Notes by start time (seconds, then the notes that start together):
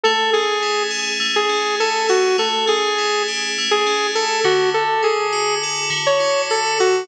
0.04 A3 A4
0.33 C#4 G#4
0.62 E4
0.91 G#4
1.20 A3
1.36 G#4
1.49 C#4
1.80 E4 A4
2.09 F#4 G#4
2.38 A3 A4
2.67 C#4 G#4
2.98 E4
3.28 G4
3.58 A3
3.71 G#4
3.87 C#4
4.15 E4 A4
4.44 D3 F#4
4.74 A4
5.03 E4 G#4
5.33 F#4
5.63 A4
5.90 D3
6.06 C#5
6.20 E4
6.50 F#4 A4
6.80 F#4 A4